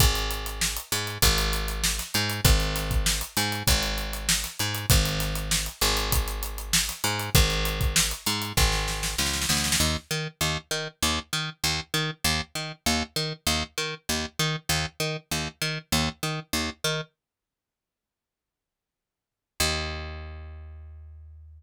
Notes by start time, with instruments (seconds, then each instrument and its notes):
0.00 electric bass (finger) G#1, kick, closed hi-hat
0.15 closed hi-hat
0.31 closed hi-hat
0.46 closed hi-hat
0.61 snare
0.77 closed hi-hat
0.92 electric bass (finger) G#2, closed hi-hat
1.07 closed hi-hat
1.22 electric bass (finger) G#1, kick, closed hi-hat
1.38 closed hi-hat
1.53 closed hi-hat
1.68 closed hi-hat
1.84 snare
1.99 snare, closed hi-hat
2.14 electric bass (finger) G#2, closed hi-hat
2.30 closed hi-hat
2.45 electric bass (finger) G#1, kick, closed hi-hat
2.60 closed hi-hat
2.76 snare, closed hi-hat
2.91 kick, closed hi-hat
3.06 snare
3.21 closed hi-hat
3.37 electric bass (finger) G#2, closed hi-hat
3.52 closed hi-hat
3.67 electric bass (finger) G#1, kick, closed hi-hat
3.83 closed hi-hat
3.98 closed hi-hat
4.13 closed hi-hat
4.29 snare
4.44 snare, closed hi-hat
4.59 electric bass (finger) G#2, closed hi-hat
4.74 closed hi-hat
4.90 electric bass (finger) G#1, kick, closed hi-hat
5.05 closed hi-hat
5.20 snare, closed hi-hat
5.35 closed hi-hat
5.51 snare
5.66 closed hi-hat
5.81 electric bass (finger) G#1, closed hi-hat
5.97 closed hi-hat
6.12 kick, closed hi-hat
6.28 closed hi-hat
6.43 closed hi-hat
6.58 closed hi-hat
6.73 snare
6.89 snare, closed hi-hat
7.04 electric bass (finger) G#2, closed hi-hat
7.19 closed hi-hat
7.35 electric bass (finger) G#1, kick, closed hi-hat
7.50 closed hi-hat
7.65 closed hi-hat
7.81 kick, closed hi-hat
7.96 snare
8.11 closed hi-hat
8.26 electric bass (finger) G#2, closed hi-hat
8.42 closed hi-hat
8.57 electric bass (finger) G#1, kick, snare
8.72 snare
8.88 snare
9.03 snare
9.18 electric bass (finger) C#2, snare
9.26 snare
9.33 snare
9.41 snare
9.49 electric bass (finger) D2, snare
9.57 snare
9.64 snare
9.72 snare
9.80 electric bass (finger) D#2
10.11 electric bass (finger) D#3
10.41 electric bass (finger) D#2
10.71 electric bass (finger) D#3
11.03 electric bass (finger) D#2
11.33 electric bass (finger) D#3
11.64 electric bass (finger) D#2
11.94 electric bass (finger) D#3
12.24 electric bass (finger) D#2
12.55 electric bass (finger) D#3
12.86 electric bass (finger) D#2
13.16 electric bass (finger) D#3
13.47 electric bass (finger) D#2
13.78 electric bass (finger) D#3
14.09 electric bass (finger) D#2
14.39 electric bass (finger) D#3
14.69 electric bass (finger) D#2
15.00 electric bass (finger) D#3
15.31 electric bass (finger) D#2
15.62 electric bass (finger) D#3
15.92 electric bass (finger) D#2
16.23 electric bass (finger) D#3
16.53 electric bass (finger) D#2
16.84 electric bass (finger) D#3
19.60 electric bass (finger) D#2